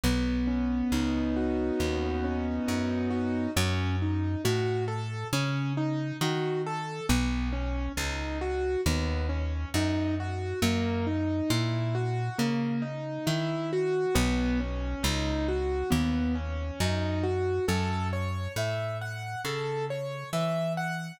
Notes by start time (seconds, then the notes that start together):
0.03 B1 B3
0.47 C#4
0.92 C#2 D#4
1.36 F#4
1.79 D#2 B3
2.24 C#4
2.68 F#2 D#4
3.10 F#4
3.56 F#2 C#4
4.02 D#4
4.45 A2 F#4
4.88 A4
5.33 C#3 C#4
5.77 D#4
6.21 D#3 F#4
6.67 A4
7.09 B1 B3
7.53 C#4
7.97 C#2 D#4
8.41 F#4
8.86 D#2 B3
9.29 C#4
9.74 F#2 D#4
10.20 F#4
10.62 F#2 A#3
11.07 D#4
11.50 A#2 E4
11.95 F#4
12.38 C#3 A#3
12.82 D#4
13.26 D#3 E4
13.73 F#4
14.15 B1 B3
14.60 C#4
15.03 C#2 D#4
15.48 F#4
15.90 D#2 B3
16.35 C#4
16.80 F#2 D#4
17.23 F#4
17.68 F#2 A4
18.13 C#5
18.56 A2 E5
19.01 F#5
19.45 C#3 A4
19.90 C#5
20.33 E3 E5
20.77 F#5